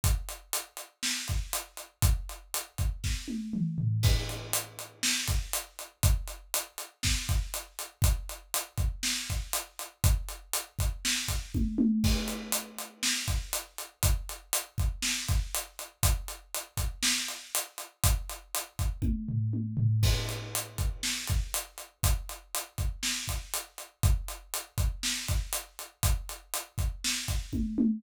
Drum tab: CC |--------|--------|x-------|--------|
HH |xxxx-xxx|xxxx----|-xxx-xxx|xxxx-xxx|
SD |----o---|----o---|----o---|----o---|
T1 |--------|-----o--|--------|--------|
T2 |--------|------o-|--------|--------|
FT |--------|-------o|--------|--------|
BD |o----o--|o--oo---|o----o--|o---oo--|

CC |--------|--------|x-------|--------|
HH |xxxx-xxx|xxxx-x--|-xxx-xxx|xxxx-xxx|
SD |----o---|----o---|----o---|----o---|
T1 |--------|------oo|--------|--------|
T2 |--------|--------|--------|--------|
FT |--------|--------|--------|--------|
BD |o--o-o--|o--o-oo-|o----o--|o--o-o--|

CC |--------|--------|x-------|--------|
HH |xxxx-xxx|xxxx----|-xxx-xxx|xxxx-xxx|
SD |----o---|--------|----o---|----o---|
T1 |--------|----o-o-|--------|--------|
T2 |--------|--------|--------|--------|
FT |--------|-----o-o|--------|--------|
BD |o--o----|o--oo---|o--o-o--|o--o-o--|

CC |--------|--------|
HH |xxxx-xxx|xxxx-x--|
SD |----o---|----o---|
T1 |--------|------oo|
T2 |--------|--------|
FT |--------|--------|
BD |o--o-o--|o--o-oo-|